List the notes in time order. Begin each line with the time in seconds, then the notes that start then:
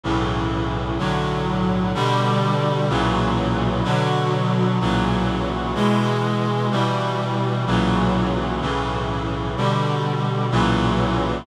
0.04 B1 A2 C#3 E3
0.98 B1 A2 D3 F#3
1.94 B2 D3 G3
2.89 B1 A#2 C#3 E3 F#3
3.84 B2 D3 F#3
4.80 B1 A#2 C#3 E3 F#3
5.75 B2 E3 G#3
6.71 B2 E3 G3
7.66 B1 A#2 C#3 E3 F#3
8.61 B1 A2 C#3 E3
9.57 B2 D3 G3
10.51 B1 A#2 C#3 E3 F#3